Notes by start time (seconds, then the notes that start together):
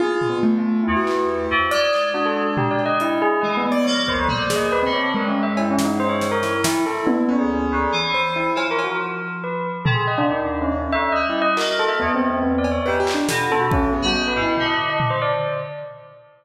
0.00 F4 G#4, high tom
0.21 floor tom
0.29 B3
0.43 A3
0.58 F4
0.84 E2 E4
0.97 F#4
1.07 clap
1.28 G4
1.51 F2
1.71 G#3 D5, closed hi-hat
1.93 clap
2.14 D4 F#4
2.26 A4
2.57 G4, floor tom
2.71 D5
2.79 cowbell
2.86 D#5
3.00 E4, closed hi-hat
3.22 G#4
3.41 E3 G#3 D#5
3.57 A3 B3
3.71 B3 D5
3.84 F3 A#3 C#5
4.07 D#2 C5, kick
4.17 D2
4.28 G3 A#3 C5, floor tom
4.42 D5
4.50 G#4, snare
4.55 D#2 D#5
4.72 B4
4.83 D3 C4
4.92 C#5
5.14 G2 G#3 A#4
5.28 C#4
5.43 E5
5.57 E4, cowbell
5.71 C#4
5.79 snare
5.85 D#4
6.00 C5
6.09 C#5
6.21 snare
6.32 A#4
6.43 E4, snare
6.64 E4, snare
6.86 E4 A4
7.07 B3, high tom
7.28 D2 C#4
7.39 G#4
7.71 D2
7.92 E3
8.14 C5
8.36 E4
8.55 F3 F4, cowbell
8.71 A#4
8.79 cowbell
8.84 F#4
9.44 B4
9.85 C3 A4, floor tom
9.94 G#4
10.07 D#5
10.18 D4
10.29 D#2 D#4
10.62 C#4
10.72 C#4
10.92 D2 E5
11.12 G3 D#5
11.30 E4
11.42 D#5
11.57 A#3 F#4 A#4, clap
11.79 A4
11.88 E5
12.00 E2 B3
12.15 C4
12.30 C4
12.43 B3
12.58 D5
12.64 cowbell
12.72 C#5
12.86 G#2 G4 B4
13.00 G4
13.07 F4, clap
13.14 D4
13.28 B2 A4, snare
13.50 A4, high tom
13.61 F#4
13.71 C#4 A4, kick
13.93 B3 G#4
14.02 G3 F#4
14.15 D#5
14.28 B4
14.36 G#2 E4
14.42 E4
14.57 D3, floor tom
14.66 D#5
14.90 D#5
15.00 floor tom
15.10 C5
15.22 D5